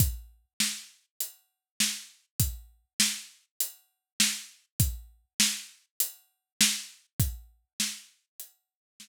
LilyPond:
\new DrumStaff \drummode { \time 4/4 \tempo 4 = 100 <hh bd>4 sn4 hh4 sn4 | <hh bd>4 sn4 hh4 sn4 | <hh bd>4 sn4 hh4 sn4 | <hh bd>4 sn4 hh4 sn4 | }